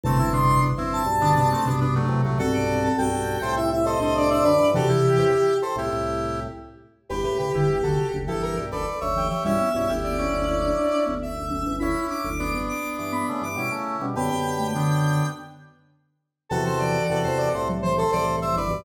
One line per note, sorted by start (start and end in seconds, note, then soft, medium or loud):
0.04 0.60 G1 loud
0.04 0.60 E2 loud
0.04 0.18 C3 loud
0.04 0.19 A3 medium
0.04 0.18 C4 loud
0.04 0.30 A5 medium
0.19 0.32 C4 medium
0.19 0.32 E4 medium
0.32 0.69 C3 loud
0.32 0.69 B3 medium
0.32 0.69 D4 medium
0.32 0.60 C6 medium
0.62 0.76 G1 medium
0.62 0.76 E2 medium
0.77 1.02 G1 medium
0.77 1.02 E2 medium
0.77 1.03 C4 medium
0.77 1.03 E4 loud
0.93 1.71 A5 medium
1.06 1.56 B1 medium
1.06 1.56 G2 medium
1.20 1.35 D3 medium
1.20 1.34 B3 medium
1.20 1.34 D4 loud
1.35 1.49 C3 medium
1.35 1.50 B3 medium
1.35 1.50 D4 medium
1.52 1.66 A3 medium
1.52 1.66 C4 medium
1.65 2.06 B1 medium
1.65 2.06 G2 medium
1.65 2.35 C3 medium
1.65 1.80 B3 medium
1.65 1.80 D4 medium
1.81 1.95 B3 medium
1.81 1.95 D4 loud
1.95 2.22 F#3 medium
1.95 2.22 A3 loud
2.08 2.22 E2 medium
2.08 2.22 C3 medium
2.25 2.39 C2 medium
2.25 2.39 A2 medium
2.25 2.38 F#3 medium
2.25 2.38 A3 medium
2.38 2.89 B1 medium
2.38 2.89 G2 loud
2.38 2.54 C4 loud
2.38 2.88 F#4 loud
2.38 2.52 A4 loud
2.38 2.88 A4 loud
2.53 2.79 D5 medium
2.68 3.06 C4 medium
2.83 2.97 A4 medium
2.98 3.12 B1 medium
2.98 3.12 G2 loud
2.98 3.38 F#4 medium
2.98 3.38 A4 medium
2.98 3.52 G5 medium
3.12 3.37 B1 medium
3.12 3.37 G2 medium
3.42 3.98 C2 medium
3.42 3.98 A2 medium
3.42 3.56 A4 medium
3.42 3.56 C5 loud
3.56 3.72 E4 medium
3.56 3.70 E5 medium
3.72 3.86 E4 medium
3.72 3.86 E5 medium
3.85 4.00 A4 medium
3.85 4.00 C5 loud
3.85 4.14 D#5 medium
4.00 4.42 C2 medium
4.00 4.42 A2 medium
4.00 4.66 D4 loud
4.00 4.29 A4 medium
4.00 4.29 C5 medium
4.17 4.30 D5 medium
4.30 4.44 C5 medium
4.30 4.67 D5 loud
4.30 4.44 E5 medium
4.44 4.58 F#2 medium
4.44 4.58 D3 medium
4.44 4.70 B4 medium
4.44 4.70 D5 loud
4.59 4.73 G2 medium
4.59 4.73 E3 medium
4.74 4.88 E2 medium
4.74 5.22 C3 loud
4.74 4.88 C3 medium
4.74 5.22 E3 loud
4.74 4.89 F#4 medium
4.74 5.57 G4 loud
4.74 4.89 A4 loud
4.88 5.54 E4 medium
4.88 5.54 G4 loud
5.18 5.32 E2 medium
5.18 5.32 C3 loud
5.62 5.76 A4 medium
5.62 5.76 C5 medium
5.76 5.90 C2 medium
5.76 5.90 A2 medium
5.76 6.40 E4 medium
5.76 6.40 G4 loud
5.93 6.47 C2 medium
5.93 6.47 A2 medium
7.09 7.24 G1 medium
7.09 7.24 E2 medium
7.09 7.23 G4 medium
7.09 8.16 G4 medium
7.09 7.23 B4 medium
7.23 7.50 C#2 medium
7.23 7.50 A2 medium
7.23 7.38 G4 medium
7.23 7.38 B4 medium
7.39 7.53 C#3 medium
7.39 7.53 G4 medium
7.39 7.53 B4 medium
7.53 7.68 G1 medium
7.53 7.68 E2 medium
7.53 7.67 D3 medium
7.53 7.79 E4 medium
7.53 7.79 G4 medium
7.68 7.82 G1 medium
7.68 7.82 E2 medium
7.83 7.97 F#1 medium
7.83 7.97 D2 medium
7.83 7.98 D3 medium
7.83 8.08 F#4 medium
7.83 8.08 A4 medium
7.97 8.22 C#3 medium
8.13 8.27 F#1 medium
8.13 8.27 D2 medium
8.27 8.57 G1 medium
8.27 8.57 E2 medium
8.27 8.54 E3 medium
8.27 8.66 E4 medium
8.27 8.66 G4 medium
8.27 8.42 A4 medium
8.42 8.56 A#4 medium
8.58 8.72 B1 medium
8.58 8.72 G2 medium
8.72 8.86 F#1 medium
8.72 8.86 D2 medium
8.72 8.86 A4 medium
8.72 9.00 B4 medium
8.72 9.00 D5 medium
9.01 9.29 F#1 medium
9.01 9.29 D2 medium
9.01 9.28 C#5 medium
9.01 9.28 E5 medium
9.16 9.30 E3 medium
9.16 9.45 G4 medium
9.30 9.45 E3 medium
9.30 9.44 C#5 medium
9.30 9.44 E5 medium
9.44 9.59 B1 medium
9.44 9.59 G2 medium
9.44 9.58 G3 medium
9.44 9.69 C#4 medium
9.44 9.69 E4 loud
9.44 9.94 E5 medium
9.61 10.18 B3 medium
9.74 9.88 B1 medium
9.74 9.88 G2 medium
9.74 9.89 C#4 medium
9.74 9.88 E4 medium
9.89 10.28 F#1 medium
9.89 10.28 D2 medium
9.89 10.18 E4 medium
9.89 10.18 G4 medium
10.03 11.04 D5 medium
10.18 10.46 C#4 medium
10.18 10.44 C#4 medium
10.18 10.46 E4 medium
10.32 10.73 F#1 medium
10.32 10.73 D2 medium
10.47 11.14 C#4 medium
10.47 11.14 E4 medium
10.63 10.92 D4 medium
10.92 11.06 D4 medium
11.06 11.35 F#1 medium
11.06 11.35 D2 medium
11.06 11.32 B3 medium
11.22 11.76 E5 medium
11.37 11.49 F#1 medium
11.37 11.49 D2 medium
11.50 11.64 F#1 medium
11.50 11.64 D2 medium
11.50 11.65 C#4 medium
11.66 11.80 G1 medium
11.66 11.80 E2 medium
11.66 11.80 C#4 medium
11.79 11.95 F#1 medium
11.79 11.95 D2 medium
11.79 12.30 C#4 medium
11.79 12.05 E4 loud
11.79 12.30 E4 medium
11.79 12.07 B5 medium
12.08 12.22 D4 medium
12.08 12.58 D6 medium
12.25 12.51 F#1 medium
12.25 12.51 D2 medium
12.39 13.45 B3 medium
12.39 13.45 D4 medium
12.53 12.67 G1 medium
12.53 12.67 E2 medium
12.53 12.78 B3 medium
12.69 12.93 D6 medium
12.98 13.24 G2 medium
12.98 13.24 E3 medium
12.98 13.12 D6 medium
13.12 13.39 B3 medium
13.12 13.26 B5 medium
13.29 13.43 C#3 medium
13.29 13.43 A3 medium
13.42 13.56 G2 medium
13.42 13.56 E3 medium
13.42 13.72 D6 medium
13.56 13.70 B2 medium
13.56 13.70 G3 medium
13.56 14.06 C#4 medium
13.56 14.06 E4 medium
13.72 13.97 C#3 medium
13.72 13.97 A3 medium
14.01 14.15 B2 medium
14.01 14.15 G3 medium
14.01 14.15 C#4 medium
14.16 14.30 F#2 medium
14.16 14.30 D3 medium
14.16 14.30 B3 medium
14.16 14.67 G4 medium
14.16 14.67 B4 medium
14.16 15.26 G5 medium
14.30 15.22 F#2 medium
14.30 15.22 D3 medium
14.30 14.56 B3 medium
14.59 14.73 A3 medium
14.74 15.24 D3 medium
14.74 15.27 B3 medium
14.74 15.27 D4 medium
16.49 16.98 E2 loud
16.49 16.98 C3 loud
16.49 16.66 E3 loud
16.49 17.03 F#4 loud
16.49 16.63 A4 loud
16.49 17.03 A4 loud
16.66 16.80 C5 medium
16.79 17.24 E3 loud
16.79 17.19 D5 medium
17.10 17.24 E2 medium
17.10 17.24 C3 medium
17.10 17.49 F#4 medium
17.10 17.49 A4 loud
17.24 17.50 E2 medium
17.24 17.50 C3 loud
17.24 17.38 C5 medium
17.38 17.52 D5 medium
17.54 18.05 C2 medium
17.54 18.05 A2 medium
17.54 17.68 A4 medium
17.54 17.68 C5 medium
17.69 17.83 F#3 medium
17.82 17.98 E3 loud
17.82 17.96 C5 medium
17.97 18.11 A4 medium
17.97 18.11 C5 loud
18.12 18.55 C2 medium
18.12 18.55 A2 medium
18.12 18.79 E3 medium
18.12 18.36 A4 medium
18.12 18.36 C5 loud
18.12 18.26 D5 medium
18.42 18.56 C5 medium
18.42 18.56 E5 loud
18.56 18.70 G1 medium
18.56 18.70 E2 medium
18.56 18.81 B4 medium
18.56 18.81 D5 medium
18.70 18.84 B1 medium
18.70 18.84 G2 loud